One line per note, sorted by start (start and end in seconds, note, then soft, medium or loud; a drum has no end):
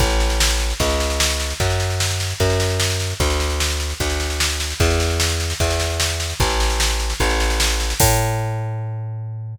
0.00 0.74 A1 medium
0.00 kick medium
0.00 snare medium
0.10 snare medium
0.20 snare medium
0.30 snare medium
0.40 snare loud
0.50 snare medium
0.60 snare medium
0.70 snare medium
0.80 1.54 C#2 medium
0.80 kick medium
0.80 snare medium
0.90 snare medium
1.00 snare medium
1.10 snare medium
1.20 snare loud
1.30 snare medium
1.40 snare medium
1.50 snare medium
1.60 2.34 F#2 medium
1.60 kick medium
1.60 snare medium
1.70 snare medium
1.80 snare medium
1.90 snare medium
2.00 snare medium
2.10 snare medium
2.20 snare medium
2.30 snare medium
2.40 3.14 F#2 medium
2.40 kick medium
2.40 snare medium
2.50 snare medium
2.60 snare medium
2.70 snare medium
2.80 snare loud
2.90 snare medium
3.00 snare medium
3.10 snare medium
3.20 3.94 D2 medium
3.20 kick medium
3.20 snare medium
3.30 snare medium
3.40 snare medium
3.50 snare medium
3.60 snare medium
3.70 snare medium
3.80 snare medium
3.90 snare medium
4.00 4.74 D2 medium
4.00 kick medium
4.00 snare medium
4.10 snare medium
4.20 snare medium
4.30 snare medium
4.40 snare loud
4.50 snare medium
4.60 snare medium
4.70 snare medium
4.80 5.54 E2 medium
4.80 kick medium
4.80 snare medium
4.90 snare medium
5.00 snare medium
5.10 snare medium
5.20 snare loud
5.30 snare medium
5.40 snare medium
5.50 snare medium
5.60 6.34 E2 medium
5.60 kick medium
5.60 snare medium
5.70 snare medium
5.80 snare medium
5.90 snare medium
6.00 snare loud
6.10 snare medium
6.20 snare medium
6.30 snare medium
6.40 7.14 A1 medium
6.40 kick medium
6.40 snare medium
6.50 snare medium
6.60 snare medium
6.70 snare medium
6.80 snare loud
6.90 snare medium
7.00 snare medium
7.10 snare medium
7.20 7.94 A1 medium
7.20 kick medium
7.20 snare medium
7.30 snare medium
7.40 snare medium
7.50 snare medium
7.60 snare loud
7.70 snare medium
7.80 snare medium
7.90 snare medium
8.00 9.56 A2 loud
8.00 kick loud
8.00 crash loud